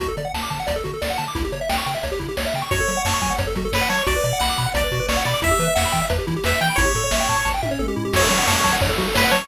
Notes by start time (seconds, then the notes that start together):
0.00 D2 F#4, kick, closed hi-hat
0.08 A4
0.17 D3 D5, closed hi-hat
0.25 F#5
0.34 D2 A5, snare
0.42 D6
0.50 D3 A5, kick, closed hi-hat
0.60 F#5
0.67 D2 D5, kick, closed hi-hat
0.76 A4
0.84 D3 F#4, kick, closed hi-hat
0.94 A4
1.02 D2 D5, snare
1.10 F#5
1.18 D3 A5, closed hi-hat
1.28 D6
1.35 C#2 E4, kick, closed hi-hat
1.45 G4
1.52 C#3 C#5, closed hi-hat
1.61 E5
1.69 C#2 G5, snare
1.78 C#6
1.86 C#3 G5, closed hi-hat
1.94 E5
2.03 C#2 C#5, kick, closed hi-hat
2.12 G4
2.19 C#3 E4, kick, closed hi-hat
2.29 G4
2.37 C#2 C#5, snare
2.46 E5
2.54 C#3 G5, closed hi-hat
2.62 C#6
2.71 F#2 F#4 C#5, kick, closed hi-hat
2.80 A4
2.88 F#3 C#5, closed hi-hat
2.97 F#5
3.05 F#2 C#5 A5, snare
3.14 C#6
3.22 F#3 G#5, kick, closed hi-hat
3.30 F#5
3.38 F#2 C#5, kick, closed hi-hat
3.47 A4
3.55 F#3 F#4, kick, closed hi-hat
3.65 A4
3.72 F#2 B4 C#5, snare
3.81 F#5
3.89 F#3 C#5 A5, closed hi-hat
3.99 C#6
4.06 B1 F#4 D5, kick, closed hi-hat
4.16 B4
4.24 B2 D5, closed hi-hat
4.33 F#5
4.40 B1 F#5 B5, snare
4.49 D6
4.57 B2 B5, kick, closed hi-hat
4.66 F#5
4.74 B1 D5, kick, closed hi-hat
4.84 B4
4.91 B2 F#4, kick, closed hi-hat
5.00 B4
5.09 B1 C#5 D5, snare
5.17 F#5
5.25 B2 D5 B5, closed hi-hat
5.34 D6
5.42 E2 E4 E5, kick, closed hi-hat
5.51 G4
5.59 E3 B4, closed hi-hat
5.68 E5
5.75 E2 E5 F#5, snare
5.85 B5
5.92 E3 G5, kick, closed hi-hat
6.02 E5
6.10 E2 B4, kick, closed hi-hat
6.19 G4
6.27 E3 E4, kick, closed hi-hat
6.36 G4
6.44 E2 B4 E5, snare
6.53 E5
6.61 E3 G5, closed hi-hat
6.70 B5
6.76 A1 E4 C#5, kick, closed hi-hat
6.85 G4
6.95 A2 A4, closed hi-hat
7.04 C#5
7.11 A1 E5, snare
7.20 G5
7.29 A2 A5, kick, closed hi-hat
7.37 C#6
7.45 A1 A5, kick, snare
7.54 G5
7.62 A2 E5, high tom
7.71 C#5
7.79 A1 A4, mid tom
7.88 G4
7.96 A2 E4
8.05 G4
8.13 F#2 F#4 C#5, kick, crash
8.22 A4
8.30 F#3 C#5, closed hi-hat
8.38 F#5
8.47 F#2 C#5 A5, snare
8.56 C#6
8.64 F#3 A5, kick, closed hi-hat
8.73 F#5
8.81 F#2 C#5, kick, closed hi-hat
8.89 A4
8.98 F#3 F#4, kick, closed hi-hat
9.08 A4
9.14 F#2 B4 C#5, snare
9.24 F#5
9.31 F#3 C#5 A5, closed hi-hat
9.42 C#6